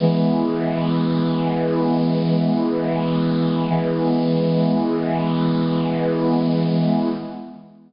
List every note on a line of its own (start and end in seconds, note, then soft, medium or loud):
0.00 3.66 E3 medium
0.00 3.66 G#3 medium
0.00 3.66 B3 medium
3.69 7.09 E3 loud
3.69 7.09 G#3 medium
3.69 7.09 B3 medium